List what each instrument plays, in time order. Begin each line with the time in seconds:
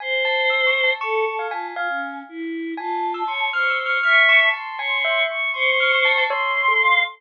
0.00 choir aahs C5, tubular bells G#5
0.25 tubular bells A5
0.50 tubular bells E6
0.67 tubular bells C#6
0.84 tubular bells A5
0.99 choir aahs A4 A5, tubular bells C#6
1.25 choir aahs A4
1.39 tubular bells F5
1.51 choir aahs F4, tubular bells G#5
1.74 choir aahs F4 G#5, tubular bells F5
1.88 choir aahs C#4
2.29 choir aahs E4
2.77 choir aahs F4 A5, tubular bells G#5
3.14 tubular bells E6
3.27 choir aahs C#5, tubular bells C6
3.53 choir aahs C5 C#6, tubular bells F6
3.70 tubular bells E6
3.80 choir aahs C#6
3.86 tubular bells F6
4.03 choir aahs E5 C#6, tubular bells F6
4.29 tubular bells C#6
4.40 choir aahs A5
4.53 tubular bells A5, choir aahs C6
4.78 choir aahs C#5, tubular bells G#5
5.05 tubular bells E5
5.29 choir aahs C#6
5.54 choir aahs C5, tubular bells C6
5.80 tubular bells F6
5.92 tubular bells C#6
6.05 tubular bells A5
6.18 tubular bells A5
6.29 tubular bells C#5, choir aahs C6
6.68 tubular bells A4
6.81 choir aahs F5